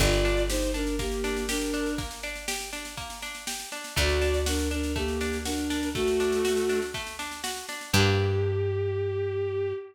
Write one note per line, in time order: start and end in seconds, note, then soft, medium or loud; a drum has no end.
0.00 3.65 G1 loud
0.00 0.22 A#3 loud
0.00 0.42 F4 medium
0.00 0.42 D5 medium
0.00 kick loud
0.00 snare loud
0.00 crash loud
0.12 snare medium
0.25 0.47 D4 medium
0.25 snare medium
0.37 snare medium
0.49 0.71 D#4 medium
0.49 0.72 G4 medium
0.49 0.71 C5 medium
0.49 snare loud
0.62 snare medium
0.74 0.96 D4 medium
0.74 0.95 D4 medium
0.74 0.95 A#4 medium
0.74 snare medium
0.87 snare medium
0.99 1.22 A#3 medium
0.99 1.43 A#3 medium
0.99 1.43 G4 medium
0.99 kick loud
0.99 snare loud
1.12 snare medium
1.24 1.46 D4 medium
1.24 snare loud
1.36 snare medium
1.49 1.93 D4 medium
1.49 1.71 G4 medium
1.49 1.93 A#4 medium
1.49 snare loud
1.61 snare medium
1.74 1.96 D4 medium
1.74 snare medium
1.86 snare medium
1.98 2.20 A#3 medium
1.98 kick loud
1.98 snare loud
2.11 snare loud
2.23 2.46 D4 medium
2.23 snare medium
2.36 snare medium
2.48 2.70 G4 medium
2.48 snare loud
2.60 snare medium
2.73 2.95 D4 medium
2.73 snare loud
2.85 snare medium
2.97 3.20 A#3 medium
2.97 kick loud
2.97 snare medium
3.10 snare medium
3.22 3.45 D4 medium
3.22 snare loud
3.35 snare medium
3.47 3.70 G4 medium
3.47 snare loud
3.60 snare medium
3.72 3.94 D4 medium
3.72 snare medium
3.84 snare loud
3.96 7.62 D2 loud
3.96 4.19 A3 loud
3.96 4.39 F#4 medium
3.96 4.39 D5 medium
3.96 kick loud
3.96 snare medium
4.09 snare medium
4.21 4.44 D4 medium
4.21 snare loud
4.34 snare medium
4.46 4.68 D4 medium
4.46 4.68 F#4 medium
4.46 4.68 A#4 medium
4.46 snare loud
4.59 snare loud
4.71 4.93 D4 medium
4.71 4.92 D4 medium
4.71 4.92 A#4 medium
4.71 snare medium
4.83 snare medium
4.96 5.18 A3 medium
4.96 5.37 A#3 medium
4.96 5.37 G4 medium
4.96 kick loud
4.96 snare medium
5.08 snare medium
5.21 5.43 D4 medium
5.21 snare loud
5.33 snare medium
5.45 5.89 D4 medium
5.45 5.68 F#4 medium
5.45 5.89 A#4 medium
5.45 snare loud
5.58 snare medium
5.70 5.92 D4 medium
5.70 snare loud
5.83 snare medium
5.95 6.80 A3 medium
5.95 6.17 A3 medium
5.95 6.80 F#4 loud
5.95 kick loud
5.95 snare loud
6.07 snare medium
6.20 6.42 D4 medium
6.20 snare loud
6.32 snare medium
6.45 6.67 F#4 medium
6.45 snare loud
6.57 snare medium
6.69 6.92 D4 medium
6.69 snare medium
6.82 snare medium
6.94 7.17 A3 medium
6.94 kick loud
6.94 snare medium
7.07 snare medium
7.19 7.41 D4 medium
7.19 snare loud
7.31 snare medium
7.44 7.66 F#4 medium
7.44 snare loud
7.56 snare medium
7.69 7.91 D4 medium
7.69 snare loud
7.81 snare medium
7.93 9.73 G2 loud
7.93 9.73 D4 medium
7.93 9.73 G4 medium
7.93 9.73 G4 loud
7.93 kick loud
7.93 crash loud
8.00 9.73 A#3 loud